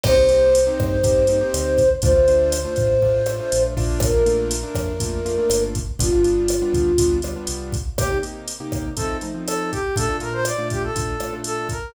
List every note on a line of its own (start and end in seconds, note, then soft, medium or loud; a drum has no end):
0.04 0.69 C2 loud
0.04 0.15 A#3 medium
0.04 0.15 C4 medium
0.04 0.15 D#4 medium
0.04 0.15 G4 medium
0.04 1.89 C5 medium
0.04 kick loud
0.04 cross-stick loud
0.04 crash loud
0.17 0.27 A#3 medium
0.17 0.27 C4 medium
0.17 0.27 D#4 medium
0.17 0.27 G4 medium
0.29 0.59 A#3 medium
0.29 0.59 C4 medium
0.29 0.59 D#4 medium
0.29 0.59 G4 medium
0.29 closed hi-hat medium
0.55 closed hi-hat loud
0.67 0.97 A#3 medium
0.67 0.97 C4 medium
0.67 0.97 D#4 medium
0.67 0.97 G4 medium
0.80 1.43 G2 medium
0.80 kick medium
0.80 cross-stick medium
1.04 1.24 A#3 medium
1.04 1.24 C4 medium
1.04 1.24 D#4 medium
1.04 1.24 G4 medium
1.04 kick medium
1.04 closed hi-hat medium
1.27 1.39 A#3 medium
1.27 1.39 C4 medium
1.27 1.39 D#4 medium
1.27 1.39 G4 medium
1.27 closed hi-hat medium
1.41 1.81 A#3 medium
1.41 1.81 C4 medium
1.41 1.81 D#4 medium
1.41 1.81 G4 medium
1.54 1.96 D2 medium
1.54 cross-stick medium
1.54 closed hi-hat loud
1.78 kick medium
1.78 closed hi-hat medium
2.02 2.66 D2 loud
2.02 2.13 A3 medium
2.02 2.13 D4 medium
2.02 2.13 F4 medium
2.02 3.63 C5 medium
2.02 kick loud
2.02 closed hi-hat medium
2.15 2.25 A3 medium
2.15 2.25 D4 medium
2.15 2.25 F4 medium
2.28 2.57 A3 medium
2.28 2.57 D4 medium
2.28 2.57 F4 medium
2.28 closed hi-hat medium
2.52 cross-stick medium
2.52 closed hi-hat loud
2.65 2.95 A3 medium
2.65 2.95 D4 medium
2.65 2.95 F4 medium
2.76 3.41 A2 medium
2.76 kick medium
2.76 closed hi-hat medium
3.02 3.22 A3 medium
3.02 3.22 D4 medium
3.02 3.22 F4 medium
3.02 kick medium
3.26 3.37 A3 medium
3.26 3.37 D4 medium
3.26 3.37 F4 medium
3.26 cross-stick medium
3.26 closed hi-hat medium
3.39 3.74 A3 medium
3.39 3.74 D4 medium
3.39 3.74 F4 medium
3.52 3.76 A#1 medium
3.52 closed hi-hat loud
3.77 4.65 A#1 medium
3.77 4.11 A3 medium
3.77 4.11 A#3 medium
3.77 4.11 D4 loud
3.77 4.11 F4 medium
3.77 kick medium
3.77 open hi-hat medium
4.00 5.61 A#4 medium
4.00 kick loud
4.00 cross-stick loud
4.00 closed hi-hat loud
4.14 4.24 A3 medium
4.14 4.24 A#3 medium
4.14 4.24 D4 medium
4.14 4.24 F4 medium
4.26 4.56 A3 medium
4.26 4.56 A#3 medium
4.26 4.56 D4 medium
4.26 4.56 F4 medium
4.26 closed hi-hat medium
4.51 closed hi-hat loud
4.63 4.93 A3 medium
4.63 4.93 A#3 medium
4.63 4.93 D4 medium
4.63 4.93 F4 medium
4.75 5.39 F2 medium
4.75 kick medium
4.75 cross-stick medium
4.75 closed hi-hat medium
5.00 5.20 A3 medium
5.00 5.20 A#3 medium
5.00 5.20 D4 medium
5.00 5.20 F4 medium
5.00 kick medium
5.00 closed hi-hat medium
5.25 5.35 A3 medium
5.25 5.35 A#3 medium
5.25 5.35 D4 medium
5.25 5.35 F4 medium
5.25 closed hi-hat medium
5.38 5.77 A3 medium
5.38 5.77 A#3 medium
5.38 5.77 D4 medium
5.38 5.77 F4 medium
5.50 5.92 G1 medium
5.50 cross-stick medium
5.50 closed hi-hat loud
5.75 kick medium
5.75 closed hi-hat medium
5.99 6.63 G1 medium
5.99 6.10 G3 medium
5.99 6.10 B3 medium
5.99 6.10 D4 medium
5.99 7.18 F4 medium
5.99 6.10 F4 medium
5.99 kick loud
5.99 closed hi-hat loud
6.12 6.22 G3 medium
6.12 6.22 B3 medium
6.12 6.22 D4 medium
6.12 6.22 F4 medium
6.24 6.54 G3 medium
6.24 6.54 B3 medium
6.24 6.54 D4 medium
6.24 6.54 F4 medium
6.24 closed hi-hat medium
6.48 cross-stick medium
6.48 closed hi-hat loud
6.62 6.92 G3 medium
6.62 6.92 B3 medium
6.62 6.92 D4 medium
6.62 6.92 F4 medium
6.73 7.36 D2 medium
6.73 kick medium
6.73 closed hi-hat medium
6.98 7.19 G3 medium
6.98 7.19 B3 medium
6.98 7.19 D4 medium
6.98 7.19 F4 medium
6.98 kick medium
6.98 closed hi-hat loud
7.22 7.34 G3 medium
7.22 7.34 B3 medium
7.22 7.34 D4 medium
7.22 7.34 F4 medium
7.22 cross-stick medium
7.22 closed hi-hat medium
7.36 7.76 G3 medium
7.36 7.76 B3 medium
7.36 7.76 D4 medium
7.36 7.76 F4 medium
7.47 7.90 C2 medium
7.47 closed hi-hat loud
7.72 kick medium
7.72 closed hi-hat medium
7.98 8.08 C3 medium
7.98 8.08 A#3 medium
7.98 8.08 D#4 medium
7.98 8.08 G4 medium
7.98 8.18 G4 loud
7.98 kick medium
7.98 cross-stick loud
7.98 closed hi-hat medium
8.11 8.21 C3 medium
8.11 8.21 A#3 medium
8.11 8.21 D#4 medium
8.11 8.21 G4 medium
8.23 8.52 C3 medium
8.23 8.52 A#3 medium
8.23 8.52 D#4 medium
8.23 8.52 G4 medium
8.23 closed hi-hat medium
8.48 closed hi-hat loud
8.60 8.90 C3 medium
8.60 8.90 A#3 medium
8.60 8.90 D#4 medium
8.60 8.90 G4 medium
8.72 kick medium
8.72 cross-stick medium
8.72 closed hi-hat medium
8.97 9.17 F3 medium
8.97 9.17 A3 medium
8.97 9.17 C4 medium
8.97 9.17 D#4 medium
8.97 9.17 A4 medium
8.97 kick medium
8.97 closed hi-hat medium
9.21 9.32 F3 medium
9.21 9.32 A3 medium
9.21 9.32 C4 medium
9.21 9.32 D#4 medium
9.21 closed hi-hat medium
9.34 9.74 F3 medium
9.34 9.74 A3 medium
9.34 9.74 C4 medium
9.34 9.74 D#4 medium
9.46 9.71 A4 loud
9.46 cross-stick medium
9.46 closed hi-hat medium
9.71 9.95 G4 loud
9.71 kick medium
9.71 closed hi-hat medium
9.96 10.06 A#2 medium
9.96 10.06 A3 medium
9.96 10.06 D4 medium
9.96 10.06 F4 medium
9.96 10.17 A4 loud
9.96 kick medium
9.96 closed hi-hat loud
10.09 10.19 A#2 medium
10.09 10.19 A3 medium
10.09 10.19 D4 medium
10.09 10.19 F4 medium
10.20 10.51 A#2 medium
10.20 10.51 A3 medium
10.20 10.51 D4 medium
10.20 10.51 F4 medium
10.20 10.33 A#4 loud
10.20 closed hi-hat medium
10.33 10.45 C5 loud
10.45 10.68 D5 loud
10.45 cross-stick medium
10.45 closed hi-hat loud
10.58 10.88 A#2 medium
10.58 10.88 A3 medium
10.58 10.88 D4 medium
10.58 10.88 F4 medium
10.70 10.83 G4 medium
10.70 kick medium
10.70 closed hi-hat medium
10.83 11.35 A4 medium
10.96 11.15 A#2 medium
10.96 11.15 A3 medium
10.96 11.15 D4 medium
10.96 11.15 F4 medium
10.96 kick medium
10.96 closed hi-hat medium
11.20 11.30 A#2 medium
11.20 11.30 A3 medium
11.20 11.30 D4 medium
11.20 11.30 F4 medium
11.20 cross-stick medium
11.20 closed hi-hat medium
11.33 11.73 A#2 medium
11.33 11.73 A3 medium
11.33 11.73 D4 medium
11.33 11.73 F4 medium
11.44 11.68 A4 loud
11.44 closed hi-hat medium
11.69 11.91 A#4 medium
11.69 kick medium
11.69 closed hi-hat medium